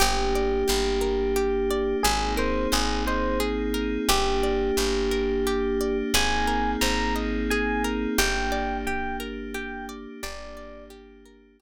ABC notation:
X:1
M:3/4
L:1/8
Q:1/4=88
K:Gphr
V:1 name="Electric Piano 1"
G6 | A c A c z2 | G6 | a2 b z a z |
g2 g z g z | d2 z4 |]
V:2 name="Pizzicato Strings"
G d G B G d | A B c e A B | G d G B G d | A B c e A B |
G d G B G d | G d G B G z |]
V:3 name="Electric Bass (finger)" clef=bass
G,,,2 G,,,4 | A,,,2 A,,,4 | G,,,2 G,,,4 | A,,,2 A,,,4 |
G,,,6 | G,,,6 |]
V:4 name="Pad 5 (bowed)"
[B,DG]6 | [B,CEA]6 | [B,DG]6 | [B,CEA]6 |
[B,DG]6 | [B,DG]6 |]